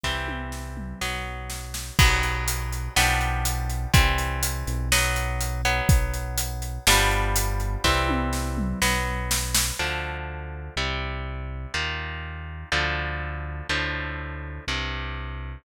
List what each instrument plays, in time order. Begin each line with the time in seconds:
0.03 synth bass 1 C2, overdriven guitar E3 G3 C4, kick, snare
0.28 high tom
0.52 snare
0.77 mid tom
1.01 synth bass 1 B1, overdriven guitar F#3 B3, snare
1.50 snare
1.74 snare
1.99 synth bass 1 B1, overdriven guitar F#3 B3, kick, crash
2.23 closed hi-hat
2.48 closed hi-hat
2.72 closed hi-hat
2.96 synth bass 1 B1, overdriven guitar F3 G3 B3 D4, snare
3.21 closed hi-hat
3.45 closed hi-hat
3.70 closed hi-hat
3.93 synth bass 1 C2, overdriven guitar E3 G3 C4, kick, closed hi-hat
4.18 closed hi-hat
4.43 closed hi-hat
4.67 synth bass 1 B1, closed hi-hat
4.92 overdriven guitar F#3 B3, snare
5.16 closed hi-hat
5.41 closed hi-hat
5.65 overdriven guitar F#3 B3, closed hi-hat
5.89 synth bass 1 B1, kick, closed hi-hat
6.14 closed hi-hat
6.38 closed hi-hat
6.62 closed hi-hat
6.87 synth bass 1 G1, overdriven guitar F3 G3 B3 D4, snare
7.11 closed hi-hat
7.36 closed hi-hat
7.60 closed hi-hat
7.84 synth bass 1 C2, overdriven guitar E3 G3 C4, kick, snare
8.09 high tom
8.33 snare
8.58 mid tom
8.82 synth bass 1 B1, overdriven guitar F#3 B3, snare
9.31 snare
9.54 snare
9.79 synth bass 1 D2, overdriven guitar D3 F3 A3
10.76 synth bass 1 C2, overdriven guitar C3 G3
11.74 synth bass 1 D#2, overdriven guitar A#2 D#3
12.72 synth bass 1 D2, overdriven guitar A2 D3 F3
13.69 synth bass 1 D2, overdriven guitar A2 D3 F3
14.67 synth bass 1 C2, overdriven guitar G2 C3